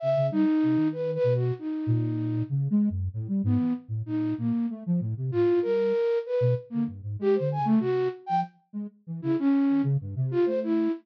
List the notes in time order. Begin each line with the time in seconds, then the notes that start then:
0.00 C#3 E5
0.16 C#3
0.31 G3 D#4
0.63 C3
0.76 D#3
0.92 B4
1.15 B4
1.24 B2
1.35 F#4
1.59 D#4
1.87 A#2
2.50 C#3
2.70 G#3
2.90 F#2
3.14 A2
3.28 G3
3.44 G#2 B3
3.59 E3
3.88 A2
4.06 A#2 D#4
4.38 A#2 A#3
4.70 A3
4.86 F3
5.00 A2
5.17 C3
5.32 A2 F4
5.47 A2
5.62 G3 A#4
6.26 B4
6.41 B2
6.70 D3 A#3
6.87 G2
7.03 G#2
7.19 G#3 G4
7.35 C5
7.40 D3
7.52 G#5
7.58 C#3
7.65 A3
7.80 C3 F#4
8.26 F3 G5
8.73 G#3
9.07 E3
9.22 C#3 E4
9.39 C#4
9.69 D#3
9.83 C#3
10.01 G2
10.16 C3
10.31 F4
10.46 A3 C5
10.63 E4